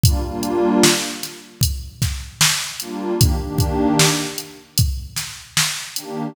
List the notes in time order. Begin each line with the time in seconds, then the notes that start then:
0.03 G3 A#3 D4 F4, kick, closed hi-hat
0.22 G3 A#3 D4 F4
0.43 closed hi-hat
0.83 snare
1.23 snare, closed hi-hat
1.61 kick, closed hi-hat
2.02 kick, snare, closed hi-hat
2.41 snare
2.80 G3 A#3 D4 F4, closed hi-hat
3.19 D#3 A#3 D4 G4, kick, closed hi-hat
3.41 D#3 A#3 D4 G4
3.58 kick, closed hi-hat
3.99 snare
4.38 closed hi-hat
4.78 kick, closed hi-hat
5.16 snare, closed hi-hat
5.57 snare
5.96 D#3 A#3 D4 G4, closed hi-hat